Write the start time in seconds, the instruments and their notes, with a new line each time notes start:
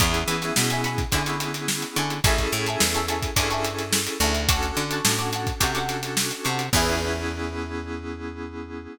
0.00 electric bass (finger) E2, electric piano 2 B3 C#4 E4 G#4, acoustic guitar (steel) E5 G#5 B5 C#6, kick, closed hi-hat
0.14 closed hi-hat
0.28 electric bass (finger) E3, closed hi-hat
0.42 acoustic guitar (steel) E5 G#5 B5 C#6, snare, closed hi-hat
0.56 electric bass (finger) B2, snare
0.70 acoustic guitar (steel) E5 G#5 B5 C#6, closed hi-hat
0.84 acoustic guitar (steel) E5 G#5 B5 C#6, snare, closed hi-hat
0.98 kick, closed hi-hat
1.12 electric bass (finger) D3, electric piano 2 B3 C#4 E4 G#4, acoustic guitar (steel) E5 G#5 B5 C#6, kick, closed hi-hat
1.26 acoustic guitar (steel) E5 G#5 B5 C#6, closed hi-hat
1.40 closed hi-hat
1.54 closed hi-hat
1.68 snare
1.82 closed hi-hat
1.96 electric bass (finger) D3, acoustic guitar (steel) E5 G#5 B5 C#6, closed hi-hat
2.10 closed hi-hat
2.24 electric bass (finger) A1, electric piano 2 C#4 E4 G#4 A4, acoustic guitar (steel) E5 G#5 A5 C#6, kick, closed hi-hat
2.38 kick, snare, closed hi-hat
2.52 electric bass (finger) A2, closed hi-hat
2.66 acoustic guitar (steel) E5 G#5 A5 C#6, closed hi-hat
2.80 electric bass (finger) E2, snare
2.94 acoustic guitar (steel) E5 G#5 A5 C#6, closed hi-hat
3.08 acoustic guitar (steel) E5 G#5 A5 C#6, closed hi-hat
3.22 kick, closed hi-hat
3.36 electric bass (finger) G2, electric piano 2 C#4 E4 G#4 A4, acoustic guitar (steel) E5 G#5 A5 C#6, kick, closed hi-hat
3.50 acoustic guitar (steel) E5 G#5 A5 C#6, closed hi-hat
3.64 closed hi-hat
3.79 snare, closed hi-hat
3.93 snare
4.07 closed hi-hat
4.20 electric bass (finger) D2, acoustic guitar (steel) E5 G#5 A5 C#6, closed hi-hat
4.35 closed hi-hat
4.49 electric piano 2 C#4 D4 F#4 A4, acoustic guitar (steel) F#5 A5 C#6 D6, kick, closed hi-hat
4.63 closed hi-hat
4.77 electric bass (finger) D3, closed hi-hat
4.91 acoustic guitar (steel) F#5 A5 C#6 D6, closed hi-hat
5.05 electric bass (finger) A2, snare
5.19 acoustic guitar (steel) F#5 A5 C#6 D6, closed hi-hat
5.32 acoustic guitar (steel) F#5 A5 C#6 D6, closed hi-hat
5.47 kick, closed hi-hat
5.60 electric bass (finger) C3, electric piano 2 C#4 D4 F#4 A4, acoustic guitar (steel) F#5 A5 C#6 D6, kick, closed hi-hat
5.75 acoustic guitar (steel) F#5 A5 C#6 D6, closed hi-hat
5.89 closed hi-hat
6.03 snare, closed hi-hat
6.17 snare
6.31 closed hi-hat
6.44 electric bass (finger) C3, acoustic guitar (steel) F#5 A5 C#6 D6, closed hi-hat
6.59 closed hi-hat
6.73 electric bass (finger) E2, electric piano 2 B3 C#4 E4 G#4, acoustic guitar (steel) E4 G#4 B4 C#5, kick, crash